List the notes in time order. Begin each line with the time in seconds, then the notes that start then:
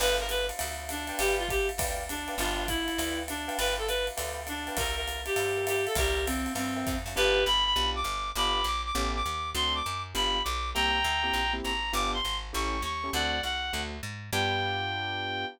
0.00 G1 B4 D5 F5 G5, crash, ride
0.19 A#4
0.29 B4, hi-hat pedal, ride
0.49 ride
0.59 D2, ride
0.89 D4, hi-hat pedal, ride
1.07 B4 D5 F5 G5, ride
1.19 G1 G4, ride
1.39 F4
1.49 G4, kick, hi-hat pedal, ride
1.69 ride
1.78 D2 B4 D5 F5 G5, kick, ride
2.09 D4, hi-hat pedal, ride
2.28 B4 D5 F5 G5, ride
2.38 G1 D4 F4 B4 D5 F5 G5, ride
2.68 E4, kick, hi-hat pedal, ride
2.88 ride
2.98 D2 B4 D5 F5 G5, ride
3.28 D4, hi-hat pedal, ride
3.48 B4 D5 F5 G5, ride
3.58 G1 B4, ride
3.78 A4
3.87 B4, hi-hat pedal, ride
4.07 ride
4.17 D2 B4 D5 F5 G5, ride
4.47 D4, hi-hat pedal, ride
4.67 B4 D5 F5 G5, ride
4.77 C2 A#4 C5 E5 G5, kick, ride
4.96 A#4
5.08 hi-hat pedal, ride
5.26 G4, ride
5.36 G2 A#4 C5 E5 G5, ride
5.57 A#4 C5 E5 G5
5.67 G4, hi-hat pedal, ride
5.86 A4, ride
5.95 C2 G4 A#4 C5 E5 G5, kick, ride
6.26 C4, hi-hat pedal, ride
6.46 ride
6.55 G2 C4, ride
6.76 A#4 C5 E5 G5
6.87 F2, kick, hi-hat pedal, ride
7.06 F#2, ride
7.16 G1 B3 D4 F4 G4 B4
7.46 G1 B5
7.65 B5
7.76 B1 B3 D4 F4 G4
7.95 D6
8.04 G1
8.36 G1 B3 D4 F4 G4 B5 D6
8.64 A#1 D6
8.85 D6
8.95 A1 A3 B3 C#4 G4
9.16 D6
9.26 D#2
9.55 D2 A3 C4 D4 F#4 C6
9.75 D6
9.86 F#2
10.14 G1 B3 D4 F4 G4 B5
10.44 B1 D6
10.74 C2 A#3 C4 E4 G4 G5 A#5
11.04 D2
11.23 A#3 C4 E4 G4
11.33 A#1
11.53 A#3 C4 E4 G4
11.64 G#1 A#5
11.93 G1 B3 D4 F4 G4 D6
12.14 C6
12.25 G#1
12.53 A1 A3 C#4 E4 G4 C#6
12.82 D#2 C#6
13.04 A3 C#4 E4 G4
13.13 D2 A3 C4 D4 F#4 D5 F#5
13.43 C2 F#5
13.73 D2 A3 C4 D4 F#4
14.03 G#2
14.33 G2 B3 D4 F4 G4 G5